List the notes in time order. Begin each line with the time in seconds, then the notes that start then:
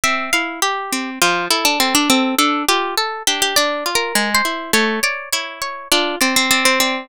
0.04 C4 E5
0.33 E4 F5
0.62 G4
0.93 C4
1.22 F3 F4
1.50 E4 A4
1.65 D4
1.80 C4 A4
1.95 D4
2.10 C4 A4
2.39 D4 A4
2.69 F4 G4
2.98 A4
3.27 D4 G4
3.42 G4
3.56 D4 D5
3.86 F4
3.95 A#4
4.15 G#3
4.35 C5
4.45 E4
4.73 A3 C#5
5.03 C#5 D5
5.33 E4 C#5
5.62 C#5
5.92 D4 F4
6.21 C4 D5
6.36 C4
6.51 C4 D5
6.65 C4
6.80 C4 D5